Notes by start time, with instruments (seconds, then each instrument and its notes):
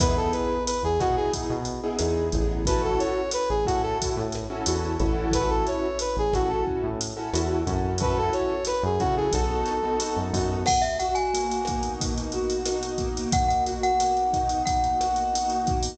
0.00 synth bass 1 E2, acoustic grand piano B3 D#4 E4 G#4, brass section B4, kick, cross-stick, closed hi-hat
0.17 brass section A4
0.32 brass section B4, closed hi-hat
0.67 brass section B4, closed hi-hat
0.83 synth bass 1 E2, brass section G#4
1.00 synth bass 1 B2, acoustic grand piano B3 D#4 E4 G#4, brass section F#4, kick, cross-stick, closed hi-hat
1.16 brass section G#4
1.33 kick, closed hi-hat
1.50 synth bass 1 B2
1.65 closed hi-hat
1.83 acoustic grand piano B3 D#4 E4 G#4
1.99 synth bass 1 E2, acoustic grand piano B3 D#4 E4 G#4, cross-stick, closed hi-hat
2.32 synth bass 1 A1, acoustic grand piano B3 D#4 E4 G#4, kick, closed hi-hat
2.65 acoustic grand piano C#4 E4 F#4 A4, brass section B4, kick, closed hi-hat
2.84 brass section A4
2.99 brass section C#5, closed hi-hat
3.31 brass section B4, cross-stick, closed hi-hat
3.49 synth bass 1 A1, brass section G#4
3.66 synth bass 1 A2, acoustic grand piano C#4 E4 F#4 A4, brass section F#4, kick, closed hi-hat
3.82 brass section A4
4.02 kick, closed hi-hat
4.17 synth bass 1 A2
4.32 cross-stick, closed hi-hat
4.50 acoustic grand piano C#4 E4 F#4 A4
4.66 synth bass 1 E2, acoustic grand piano C#4 E4 F#4 A4, closed hi-hat
5.00 synth bass 1 A1, acoustic grand piano C#4 E4 F#4 A4, kick, closed hi-hat
5.31 brass section B4, kick, cross-stick, closed hi-hat
5.50 brass section A4
5.67 brass section C#5, closed hi-hat
5.99 brass section B4, closed hi-hat
6.17 synth bass 1 A1, brass section G#4
6.33 synth bass 1 A1, acoustic grand piano C#4 E4 F#4 A4, brass section F#4, kick, cross-stick, closed hi-hat
6.48 brass section A4
6.67 kick
6.83 synth bass 1 A2
7.01 closed hi-hat
7.17 acoustic grand piano C#4 E4 F#4 A4
7.33 synth bass 1 E2, acoustic grand piano C#4 E4 F#4 A4, cross-stick, closed hi-hat
7.67 synth bass 1 F#2, acoustic grand piano C#4 E4 F#4 A4, kick, closed hi-hat
7.98 acoustic grand piano C#4 E4 F#4 A4, brass section B4, kick, closed hi-hat
8.18 brass section A4
8.33 brass section C#5, closed hi-hat
8.65 brass section B4, cross-stick, closed hi-hat
8.83 synth bass 1 F#2, brass section G#4
8.99 synth bass 1 C#3, acoustic grand piano C#4 E4 F#4 A4, brass section F#4, kick, closed hi-hat
9.17 brass section G#4
9.32 synth bass 1 B1, acoustic grand piano B3 D#4 F#4 A4, brass section A4, kick, closed hi-hat
9.66 cross-stick, closed hi-hat
9.83 acoustic grand piano B3 D#4 F#4 A4
10.00 acoustic grand piano B3 D#4 F#4 A4, closed hi-hat
10.17 synth bass 1 F#2
10.33 synth bass 1 F#2, acoustic grand piano B3 D#4 F#4 A4, kick, open hi-hat
10.66 acoustic grand piano B2, glockenspiel F#5, kick, cross-stick, crash
10.82 glockenspiel E5, closed hi-hat
10.99 acoustic grand piano F#4, glockenspiel F#5, closed hi-hat
11.15 glockenspiel G#5, closed hi-hat
11.34 acoustic grand piano A#3, closed hi-hat
11.52 closed hi-hat
11.65 acoustic grand piano D#4, kick, cross-stick, closed hi-hat
11.83 closed hi-hat
12.00 acoustic grand piano B2, kick, closed hi-hat
12.18 closed hi-hat
12.32 acoustic grand piano F#4, closed hi-hat
12.50 closed hi-hat
12.66 acoustic grand piano D#4, cross-stick, closed hi-hat
12.83 closed hi-hat
12.98 acoustic grand piano A#3, kick, closed hi-hat
13.17 closed hi-hat
13.32 acoustic grand piano B2, glockenspiel F#5, kick, closed hi-hat
13.48 glockenspiel F#5, closed hi-hat
13.66 acoustic grand piano F#4, closed hi-hat
13.83 glockenspiel F#5, closed hi-hat
14.00 acoustic grand piano A#3, cross-stick, closed hi-hat
14.17 closed hi-hat
14.33 acoustic grand piano D#4, kick, closed hi-hat
14.49 closed hi-hat
14.66 acoustic grand piano B2, glockenspiel F#5, kick, closed hi-hat
14.84 closed hi-hat
15.00 acoustic grand piano F#4, cross-stick, closed hi-hat
15.16 closed hi-hat
15.33 acoustic grand piano D#4, closed hi-hat
15.50 closed hi-hat
15.67 acoustic grand piano A#3, kick, closed hi-hat
15.83 open hi-hat